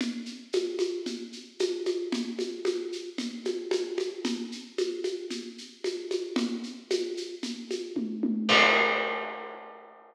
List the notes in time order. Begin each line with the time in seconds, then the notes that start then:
0.01 low conga, shaker
0.26 shaker
0.53 high conga, shaker
0.79 high conga, shaker
1.06 low conga, shaker
1.32 shaker
1.59 high conga, shaker
1.86 high conga, shaker
2.12 low conga, shaker
2.39 high conga, shaker
2.65 high conga, shaker
2.92 shaker
3.18 low conga, shaker
3.45 high conga, shaker
3.71 high conga, shaker
3.98 high conga, shaker
4.25 low conga, shaker
4.52 shaker
4.78 high conga, shaker
5.04 high conga, shaker
5.30 low conga, shaker
5.58 shaker
5.84 high conga, shaker
6.11 high conga, shaker
6.36 low conga, shaker
6.63 shaker
6.90 high conga, shaker
7.17 shaker
7.43 low conga, shaker
7.71 high conga, shaker
7.96 kick, high tom
8.23 high tom
8.49 kick, crash